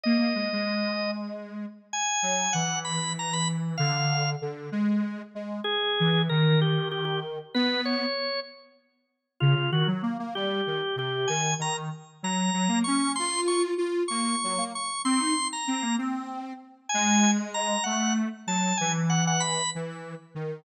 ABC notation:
X:1
M:6/8
L:1/16
Q:3/8=64
K:G#m
V:1 name="Drawbar Organ"
d8 z4 | g4 f2 b2 a b z2 | ^e4 z8 | G4 A2 =G2 G G z2 |
B2 c4 z6 | [K:Bbm] F2 G z3 =G4 G2 | a2 b z3 b4 d'2 | c'2 d' z3 d'4 d'2 |
c'3 b3 z6 | [K:G#m] g3 z a2 f2 z2 =a2 | g z f f b2 z6 |]
V:2 name="Lead 1 (square)"
A, A, G, G,9 | z2 F,2 E,8 | =D,4 D,2 G,4 G,2 | z2 E,2 D,8 |
B,4 z8 | [K:Bbm] D, D, E, G, B, B, =G,2 E, z C,2 | E,2 E,2 z2 G,2 G, B, D2 | F4 F2 B,2 G, B, z2 |
C E z2 C B, C4 z2 | [K:G#m] G,6 =A,3 z F,2 | E,6 E,3 z D,2 |]